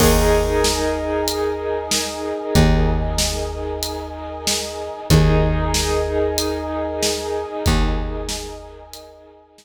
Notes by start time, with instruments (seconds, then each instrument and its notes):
0.00 electric bass (finger) D#2, acoustic grand piano D#4 G#4 A#4, brass section A#4 D#5 G#5, kick, crash
0.64 snare
1.28 closed hi-hat
1.91 snare
2.55 electric bass (finger) D#2, kick, closed hi-hat
3.18 snare
3.83 closed hi-hat
4.47 snare
5.10 electric bass (finger) D#2, acoustic grand piano D#4 G#4 A#4, brass section A#4 D#5 G#5, kick, closed hi-hat
5.74 snare
6.38 closed hi-hat
7.03 snare
7.66 electric bass (finger) D#2, kick, closed hi-hat
8.29 snare
8.93 closed hi-hat
9.58 snare